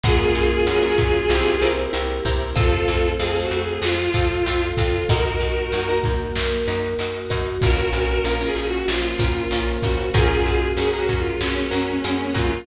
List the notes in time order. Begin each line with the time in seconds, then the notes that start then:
0.04 F#2 G#3 A#3 C#4 F4 F#4 G#4 A#4, kick, closed hi-hat
0.35 F#2, closed hi-hat
0.67 F#2 F#3 G#3 A#3 C#4 F#4 G#4 A#4, closed hi-hat
0.83 C#4 F#4 G#4 A#4
0.98 F#2, kick, closed hi-hat
1.29 C2 G3 A#3 C4 E4 G4 A#4, snare
1.61 C2 C4 E4 G4 A#4, closed hi-hat
1.93 C2 G3 A#3 C4 E4 G4 A#4, closed hi-hat
2.25 C2 C4 E4 G4 A#4, kick, closed hi-hat
2.56 F2 A3 C4 F4 A4, kick, closed hi-hat
2.88 F2, closed hi-hat
3.19 F2 C4 F4 G#4 A4, closed hi-hat
3.35 C4 F4 A4
3.41 F#4
3.51 F2, closed hi-hat
3.63 G#4
3.82 F2 F3 A3 F4, snare
4.14 F2 C4 F4 A4, kick, closed hi-hat
4.46 F2 C4 F4 A4, closed hi-hat
4.77 F2 C4 F4 A4, kick, closed hi-hat
5.09 F#2 A#3 D#4 F#4 A#4, kick, closed hi-hat
5.40 F#2, closed hi-hat
5.72 F#2 D#4 F#4 A#4, closed hi-hat
5.89 D#4 F#4 A#4
6.04 F#2, kick, closed hi-hat
6.35 F#2 A#3 F#4 A#4, snare
6.67 F#2 D#4 F#4 A#4, closed hi-hat
6.99 F#2 D#4 F#4 A#4, closed hi-hat
7.30 F#2 D#4 F#4 A#4, kick, closed hi-hat
7.61 A#1 A#3 C#4 F4 F#4 A#4, kick, closed hi-hat
7.93 A#1, closed hi-hat
8.24 A#1 C#4 F4 A#4, closed hi-hat
8.41 C#4 F4 A#4
8.46 G#4
8.56 A#1, closed hi-hat
8.68 F#4
8.88 A#1 F3 A#3 F4, snare
9.19 A#1 C#4 F4 A#4, kick, closed hi-hat
9.51 A#1 C#4 F4 A#4, closed hi-hat
9.82 A#1 C#4 F4 F#4 A#4, kick, closed hi-hat
10.14 F#2 G#3 A#3 C#4 F4 F#4 G#4 A#4, kick, closed hi-hat
10.46 F#2, closed hi-hat
10.77 F#2 C#4 F#4 G#4 A#4, closed hi-hat
10.93 C#4 F#4 G#4 A#4
10.98 F#4
11.09 F#2, kick, closed hi-hat
11.19 F4
11.40 F#2 F#3 G#3 A#3 C#4 F#4, snare
11.71 F#2 C#4 F#4 G#4 A#4, closed hi-hat
12.04 F#2 C#4 F#4 G#4 A#4, closed hi-hat
12.34 F#2 C#4 F4 F#4 G#4 A#4, kick, closed hi-hat